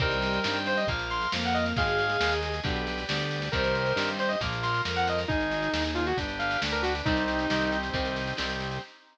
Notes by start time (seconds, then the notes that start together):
0.00 C2 D#3 G3 C4 A#4 C5 D#5 G5, kick, snare
0.11 snare
0.22 snare
0.33 snare
0.44 G2 D#3 G3 C4 G4 C5 D#5 G5, snare
0.55 snare
0.66 C5, snare
0.77 D#5, snare
0.87 A#1 F3 A#3 A#4 F5, kick, snare
0.99 snare
1.10 C6, snare
1.21 snare
1.32 F2 F3 A#3 A#4 F5, snare
1.43 F#5, snare
1.54 D#5, snare
1.65 snare
1.76 G#1 D#3 G#3 G#4 D#5 F5, kick, snare
1.87 snare
1.99 snare
2.10 snare
2.20 D#2 D#3 G#3 G#4 D#5, snare
2.32 snare
2.43 snare
2.54 snare
2.64 B1 D3 G3 B3 G4 B4 D5, kick, snare
2.76 snare
2.87 snare
2.98 snare
3.07 D2 D3 G3 B3 G4 B4 D5 G5, snare
3.20 snare
3.31 snare
3.42 snare
3.52 C2 D#3 G3 C4 G4 A#4 C5 D#5, kick, snare
3.64 snare
3.75 snare
3.86 snare
3.96 G2 D#3 G3 C4 G4 C5 D#5 G5, snare
4.08 snare
4.19 C5, snare
4.28 D#5, snare
4.41 A#1 F3 A#3 F4 A#4, kick, snare
4.52 snare
4.63 C6, snare
4.74 snare
4.85 F2 F3 A#3 F4 A#4, snare
4.96 F#5, snare
5.07 D#5, snare
5.18 snare
5.28 G#1 D#4 G#4, kick, snare
5.40 snare
5.51 snare
5.62 snare
5.73 D#2 D#4 G#4, snare
5.85 snare
5.95 F4, snare
6.07 F#4, snare
6.17 G1 D4 G4 B4, kick, snare
6.29 snare
6.39 F5, snare
6.51 snare
6.61 D2 D4 G4 B4 D5, snare
6.72 A#4, snare
6.82 F#4, snare
6.95 snare
7.05 C2 D#3 G3 C4 D#4 G4, kick, snare
7.17 D#4, snare
7.28 snare
7.39 snare
7.50 C2 D#3 G3 C4 D#4 G4, snare
7.61 snare
7.72 C4 D#4 G4, snare
7.83 snare
7.93 C2 D#3 G3 C4 D#4 G4, kick, snare
8.05 snare
8.16 snare
8.27 snare
8.37 C2 D#3 G3 C4 D#4 G4, snare
8.49 snare
8.60 snare
8.71 snare